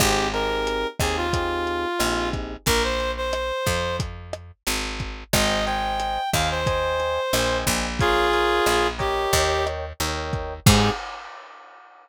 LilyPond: <<
  \new Staff \with { instrumentName = "Clarinet" } { \time 4/4 \key aes \major \tempo 4 = 90 g'8 bes'4 aes'16 f'4.~ f'16 r8 | bes'16 c''8 c''4~ c''16 r2 | ees''8 g''4 f''16 c''4.~ c''16 r8 | <f' aes'>4. g'4 r4. |
aes'4 r2. | }
  \new Staff \with { instrumentName = "Electric Piano 1" } { \time 4/4 \key aes \major <c' ees' g' aes'>8 <c' ees' g' aes'>4 <c' ees' g' aes'>8 <c' ees' g' aes'>4 <c' ees' g' aes'>4 | r1 | <c'' ees'' g'' aes''>8 <c'' ees'' g'' aes''>4 <c'' ees'' g'' aes''>8 <c'' ees'' g'' aes''>4 <c'' ees'' g'' aes''>4 | <bes' des'' f'' aes''>8 <bes' des'' f'' aes''>4 <bes' des'' ees'' g''>4. <bes' des'' ees'' g''>4 |
<c' ees' g' aes'>4 r2. | }
  \new Staff \with { instrumentName = "Electric Bass (finger)" } { \clef bass \time 4/4 \key aes \major aes,,4. ees,4. bes,,4 | bes,,4. f,4. aes,,4 | aes,,4. ees,4. bes,,8 bes,,8~ | bes,,4 bes,,4 ees,4 ees,4 |
aes,4 r2. | }
  \new DrumStaff \with { instrumentName = "Drums" } \drummode { \time 4/4 <hh bd ss>8 hh8 hh8 <hh bd ss>8 <hh bd>8 hh8 <hh ss>8 <hh bd>8 | <hh bd>8 hh8 <hh ss>8 <hh bd>8 <hh bd>8 <hh ss>8 hh8 <hh bd>8 | <hh bd ss>8 hh8 hh8 <hh bd ss>8 <hh bd>8 hh8 <hh ss>8 <hh bd>8 | <hh bd>8 hh8 <hh ss>8 <hh bd>8 <hh bd>8 <hh ss>8 hh8 <hh bd>8 |
<cymc bd>4 r4 r4 r4 | }
>>